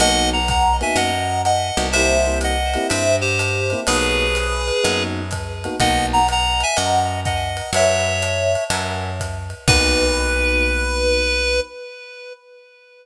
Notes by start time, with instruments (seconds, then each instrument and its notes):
0.00 electric bass (finger) B1, electric piano 1 A#3 B3 D#4 F#4, clarinet D#5 F#5, ride
0.33 clarinet F#5 A#5
0.48 clarinet F#5 A#5, kick, hi-hat pedal, ride
0.81 electric piano 1 A#3 B3 D#4 F#4, clarinet E5 G#5, ride
0.96 electric bass (finger) F#2, clarinet D#5 F#5, ride
1.45 clarinet D#5 F#5, hi-hat pedal, ride
1.77 electric bass (finger) C2, electric piano 1 A#3 B3 D#4 F#4, ride
1.92 electric piano 1 A#3 C4 E4 G4, clarinet C5 E5, ride
2.26 electric piano 1 A#3 C4 E4 G4
2.41 clarinet D#5 F#5, hi-hat pedal, ride
2.74 electric piano 1 A#3 C4 E4 G4, ride
2.89 electric bass (finger) G2, clarinet C5 E5, ride
3.21 clarinet G4 C5
3.39 hi-hat pedal, ride
3.70 electric piano 1 A#3 C4 E4 G4, ride
3.87 electric bass (finger) B1, electric piano 1 A#3 B3 D#4 F#4, clarinet G#4 B4, ride
4.35 hi-hat pedal, ride
4.68 ride
4.83 electric bass (finger) F#2, electric piano 1 A#3 B3 D#4 F#4, ride
5.31 kick, hi-hat pedal, ride
5.64 electric piano 1 A#3 B3 D#4 F#4, ride
5.80 electric bass (finger) B1, electric piano 1 A#3 B3 D#4 F#4, clarinet D#5 F#5, kick, ride
6.13 clarinet F#5 A#5
6.28 clarinet F#5 A#5, hi-hat pedal, ride
6.60 clarinet E5 G#5, ride
6.76 electric bass (finger) F#2, clarinet D#5 F#5, ride
7.25 clarinet D#5 F#5, kick, hi-hat pedal, ride
7.57 ride
7.73 electric bass (finger) F#2, electric piano 1 B4 C#5 E5 F#5, clarinet C#5 E5, ride
8.22 hi-hat pedal, ride
8.55 ride
8.70 electric bass (finger) F#2, electric piano 1 A#4 E5 F#5 G#5, ride
9.20 kick, hi-hat pedal, ride
9.50 ride
9.68 electric bass (finger) B1, electric piano 1 A#3 B3 D#4 F#4, clarinet B4, kick, crash